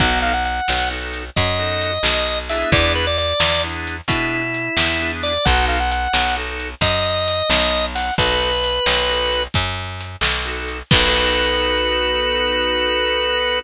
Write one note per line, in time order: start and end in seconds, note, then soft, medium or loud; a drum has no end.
0.00 0.61 B1 loud
0.00 0.32 B3 loud
0.00 0.32 D#4 medium
0.00 0.32 F#4 medium
0.00 0.32 A4 medium
0.00 0.19 F#5 loud
0.00 kick medium
0.00 closed hi-hat medium
0.22 0.33 F5 loud
0.33 0.44 F#5 loud
0.45 0.89 F#5 medium
0.45 closed hi-hat medium
0.68 1.30 B1 medium
0.68 snare medium
0.91 1.23 B3 medium
0.91 1.23 D#4 medium
0.91 1.23 F#4 medium
0.91 1.23 A4 medium
1.13 closed hi-hat medium
1.36 1.98 F#2 medium
1.36 2.39 D#5 medium
1.36 kick medium
1.36 closed hi-hat medium
1.59 1.91 B3 medium
1.59 1.91 D#4 medium
1.59 1.91 F#4 medium
1.59 1.91 A4 medium
1.81 closed hi-hat medium
2.03 2.64 B1 medium
2.03 snare medium
2.49 3.05 B3 medium
2.49 3.05 D4 medium
2.49 3.05 E4 medium
2.49 3.05 G#4 medium
2.49 2.70 E5 loud
2.49 open hi-hat medium
2.72 3.33 E2 loud
2.72 2.92 D5 loud
2.72 kick medium
2.72 closed hi-hat medium
2.95 3.06 B4 medium
3.07 3.17 D5 loud
3.18 3.62 D5 loud
3.18 closed hi-hat medium
3.40 4.01 E2 medium
3.40 snare loud
3.64 3.96 B3 medium
3.64 3.96 D4 medium
3.64 3.96 E4 medium
3.64 3.96 G#4 medium
3.87 closed hi-hat medium
4.08 4.69 B2 medium
4.08 4.41 B3 medium
4.08 4.41 D4 medium
4.08 5.11 E4 medium
4.08 4.41 E4 medium
4.08 4.41 G#4 medium
4.08 kick medium
4.08 closed hi-hat medium
4.54 closed hi-hat medium
4.77 5.38 E2 medium
4.77 snare medium
5.00 5.32 B3 medium
5.00 5.32 D4 medium
5.00 5.32 E4 medium
5.00 5.32 G#4 medium
5.23 5.45 D5 loud
5.23 closed hi-hat medium
5.45 6.08 B1 loud
5.45 5.78 B3 medium
5.45 5.78 D#4 medium
5.45 5.78 F#4 medium
5.45 5.78 A4 medium
5.45 5.65 F#5 loud
5.45 kick medium
5.45 closed hi-hat medium
5.68 5.79 F5 medium
5.80 5.91 F#5 loud
5.91 6.36 F#5 loud
5.91 closed hi-hat medium
6.13 6.75 B1 medium
6.13 snare medium
6.36 6.68 B3 medium
6.36 6.68 D#4 medium
6.36 6.68 F#4 medium
6.36 6.68 A4 medium
6.60 closed hi-hat medium
6.81 7.42 F#2 medium
6.81 7.86 D#5 loud
6.81 kick medium
6.81 closed hi-hat medium
7.28 closed hi-hat medium
7.50 8.11 B1 medium
7.50 snare loud
7.95 8.14 F#5 medium
7.95 open hi-hat medium
8.18 8.79 B1 medium
8.18 8.50 B3 medium
8.18 8.50 D#4 medium
8.18 8.50 F#4 medium
8.18 8.50 A4 medium
8.18 9.43 B4 loud
8.18 kick medium
8.18 closed hi-hat medium
8.64 closed hi-hat medium
8.86 9.48 B1 medium
8.86 snare medium
9.09 9.41 B3 medium
9.09 9.41 D#4 medium
9.09 9.41 F#4 medium
9.09 9.41 A4 medium
9.32 closed hi-hat medium
9.54 10.16 F#2 medium
9.54 kick medium
9.54 closed hi-hat medium
10.00 closed hi-hat medium
10.21 10.82 B1 medium
10.21 snare medium
10.45 10.77 B3 medium
10.45 10.77 D#4 medium
10.45 10.77 F#4 medium
10.45 10.77 A4 medium
10.68 closed hi-hat medium
10.91 13.61 B1 loud
10.91 13.59 B3 loud
10.91 13.59 D#4 loud
10.91 13.59 F#4 loud
10.91 13.59 A4 loud
10.91 13.59 B4 loud
10.91 kick loud
10.91 crash loud